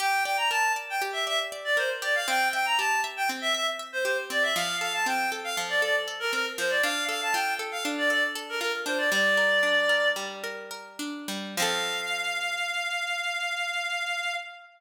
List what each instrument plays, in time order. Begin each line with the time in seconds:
0.00 orchestral harp G4, clarinet G5
0.25 orchestral harp D5, clarinet G5
0.37 clarinet A#5
0.50 orchestral harp A#4, clarinet A5
0.76 orchestral harp D5
0.90 clarinet G5
1.02 orchestral harp G4
1.13 clarinet E5
1.27 orchestral harp D5, clarinet E5
1.52 orchestral harp D5
1.64 clarinet D5
1.77 orchestral harp A#4, clarinet C5
2.02 orchestral harp G4, clarinet D5
2.15 clarinet F5
2.28 orchestral harp C4, clarinet G5
2.53 orchestral harp E5, clarinet G5
2.66 clarinet A#5
2.78 orchestral harp G4, clarinet A5
3.04 orchestral harp E5
3.17 clarinet G5
3.29 orchestral harp C4
3.41 clarinet E5
3.55 orchestral harp E5, clarinet E5
3.79 orchestral harp E5
3.92 clarinet C5
4.05 orchestral harp G4, clarinet C5
4.30 orchestral harp C4, clarinet D5
4.43 clarinet E5
4.56 orchestral harp F3, clarinet F5
4.81 orchestral harp A4, clarinet F5
4.94 clarinet A5
5.06 orchestral harp C4, clarinet G5
5.32 orchestral harp A4
5.44 clarinet F5
5.57 orchestral harp F3
5.69 clarinet D5
5.82 orchestral harp A4, clarinet D5
6.08 orchestral harp A4
6.20 clarinet A#4
6.33 orchestral harp C4, clarinet A#4
6.58 orchestral harp F3, clarinet C5
6.70 clarinet D5
6.83 orchestral harp D4, clarinet F5
7.09 orchestral harp A4, clarinet F5
7.22 clarinet A5
7.33 orchestral harp F4, clarinet G5
7.59 orchestral harp A4
7.72 clarinet F5
7.85 orchestral harp D4
7.98 clarinet D5
8.10 orchestral harp A4, clarinet D5
8.35 orchestral harp A4
8.49 clarinet A#4
8.60 orchestral harp F4, clarinet A#4
8.86 orchestral harp D4, clarinet C5
8.98 clarinet D5
9.12 orchestral harp G3, clarinet D5
9.37 orchestral harp A#4
9.63 orchestral harp D4
9.89 orchestral harp A#4
10.16 orchestral harp G3
10.44 orchestral harp A#4
10.71 orchestral harp A#4
10.99 orchestral harp D4
11.28 orchestral harp G3
11.57 orchestral harp F3 C4, clarinet F5
11.62 orchestral harp A4